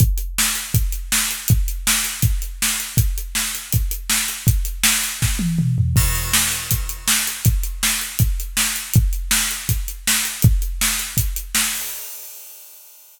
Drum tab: CC |--------|--------|--------|--------|
HH |xx-xxx-x|xx-xxx-x|xx-xxx-x|xx-x----|
SD |--o---o-|--o---o-|--o---o-|--o-o---|
T1 |--------|--------|--------|-----o--|
T2 |--------|--------|--------|------o-|
FT |--------|--------|--------|-------o|
BD |o---o---|o---o---|o---o---|o---o---|

CC |x-------|--------|--------|--------|
HH |-x-xxx-x|xx-xxx-x|xx-xxx-x|xx-xxx-o|
SD |--o---o-|--o---o-|--o---o-|--o---o-|
T1 |--------|--------|--------|--------|
T2 |--------|--------|--------|--------|
FT |--------|--------|--------|--------|
BD |o---o---|o---o---|o---o---|o---o---|